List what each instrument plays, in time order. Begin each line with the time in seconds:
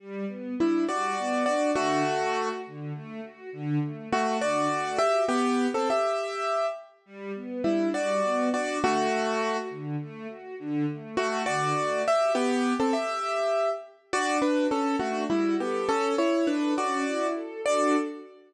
0.00 string ensemble 1 G3
0.28 string ensemble 1 B3
0.58 acoustic grand piano G3 E4, string ensemble 1 D4
0.87 string ensemble 1 G3, acoustic grand piano F#4 D5
1.18 string ensemble 1 B3
1.45 string ensemble 1 D4, acoustic grand piano F#4 D5
1.75 string ensemble 1 D3, acoustic grand piano A3 F#4
2.06 string ensemble 1 A3
2.35 string ensemble 1 F#4
2.66 string ensemble 1 D3
2.94 string ensemble 1 A3
3.23 string ensemble 1 F#4
3.52 string ensemble 1 D3
3.82 string ensemble 1 A3
4.12 acoustic grand piano A3 F#4, string ensemble 1 F#4
4.41 string ensemble 1 D3, acoustic grand piano F#4 D5
4.71 string ensemble 1 A3
4.98 string ensemble 1 F#4, acoustic grand piano G4 E5
5.28 acoustic grand piano B3 G4
5.74 acoustic grand piano C4 A4
5.90 acoustic grand piano G4 E5
7.06 string ensemble 1 G3
7.35 string ensemble 1 B3
7.64 acoustic grand piano G3 E4, string ensemble 1 D4
7.94 string ensemble 1 G3, acoustic grand piano F#4 D5
8.23 string ensemble 1 B3
8.52 string ensemble 1 D4, acoustic grand piano F#4 D5
8.82 string ensemble 1 D3, acoustic grand piano A3 F#4
9.11 string ensemble 1 A3
9.42 string ensemble 1 F#4
9.70 string ensemble 1 D3
10.01 string ensemble 1 A3
10.29 string ensemble 1 F#4
10.59 string ensemble 1 D3
10.89 string ensemble 1 A3
11.17 acoustic grand piano A3 F#4, string ensemble 1 F#4
11.46 string ensemble 1 D3, acoustic grand piano F#4 D5
11.77 string ensemble 1 A3
12.05 string ensemble 1 F#4, acoustic grand piano G4 E5
12.35 acoustic grand piano B3 G4
12.80 acoustic grand piano C4 A4
12.93 acoustic grand piano G4 E5
14.13 string ensemble 1 D4, acoustic grand piano F#4 D5
14.42 acoustic grand piano D4 B4, string ensemble 1 F#4
14.70 acoustic grand piano C#4 A4, string ensemble 1 A4
14.99 acoustic grand piano A3 F#4, string ensemble 1 D4
15.30 acoustic grand piano G3 E4, string ensemble 1 F#4
15.59 acoustic grand piano B3 G4, string ensemble 1 A4
15.87 string ensemble 1 C#4, acoustic grand piano C#4 A4
16.18 string ensemble 1 E4, acoustic grand piano E4 C#5
16.47 acoustic grand piano D4 B4, string ensemble 1 A4
16.77 string ensemble 1 C#4, acoustic grand piano F#4 D5
17.06 string ensemble 1 E4
17.35 string ensemble 1 A4
17.65 string ensemble 1 D4 F#4 A4, acoustic grand piano D5